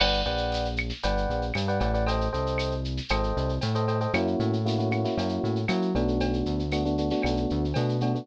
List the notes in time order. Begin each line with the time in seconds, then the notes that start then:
0.00 G1 B4 D5 F#5 G5, crash, cowbell, claves
0.13 shaker
0.25 A#1 B4 D5 F#5 G5, shaker
0.37 shaker
0.52 tambourine, shaker
0.65 shaker
0.77 claves, shaker
0.90 snare, shaker
1.03 G1 B4 D5 F#5 G5, cowbell, shaker
1.17 shaker
1.30 A#1, shaker
1.42 shaker
1.54 G2, tambourine, cowbell, claves, shaker
1.68 B4 D5 F#5 G5, shaker
1.80 A1 B4 D5 F#5 G5, cowbell, shaker
1.94 B4 D5 F#5 G5, shaker
2.06 A4 C5 D#5 G5, cowbell, shaker
2.21 shaker
2.33 C2 A4 C5 D#5 G5, shaker
2.46 shaker
2.58 tambourine, claves, shaker
2.71 shaker
2.85 shaker
2.97 snare, shaker
3.09 G#1 A4 C5 D#5 G5, cowbell, claves, shaker
3.23 shaker
3.37 C2, shaker
3.49 shaker
3.61 A2, tambourine, cowbell, shaker
3.75 A4 C5 D#5 G5, shaker
3.88 A4 C5 D#5 G5, cowbell, shaker
4.00 A4 C5 D#5 G5, shaker
4.13 F#2 A#3 C#4 E4 F#4, cowbell, claves, shaker
4.27 shaker
4.39 A2, shaker
4.53 shaker
4.66 A#3 C#4 E4 F#4, tambourine, shaker
4.78 A#3 C#4 E4 F#4, shaker
4.91 A#3 C#4 E4 F#4, claves, shaker
5.04 A#3 C#4 E4 F#4, snare, shaker
5.17 F#2 A#3 C#4 E4 F#4, cowbell, shaker
5.29 shaker
5.43 A2, shaker
5.56 shaker
5.68 F#3 A#3 C#4 E4 F#4, tambourine, cowbell, claves, shaker
5.82 shaker
5.95 B1 A3 B3 D4 F#4, cowbell, shaker
6.08 shaker
6.20 cowbell, shaker
6.33 shaker
6.46 D2, shaker
6.59 shaker
6.72 A3 B3 D4 F#4, tambourine, claves, shaker
6.85 A3 B3 D4 F#4, shaker
6.98 A3 B3 D4 F#4, shaker
7.10 A3 B3 D4 F#4, snare, shaker
7.22 B1 A3 B3 D4 F#4, cowbell, claves, shaker
7.37 shaker
7.50 D2, shaker
7.64 shaker
7.74 B2 A3 B3 D4 F#4, tambourine, cowbell, shaker
7.89 shaker
8.01 A3 B3 D4 F#4, cowbell, shaker
8.15 A3 B3 D4 F#4, shaker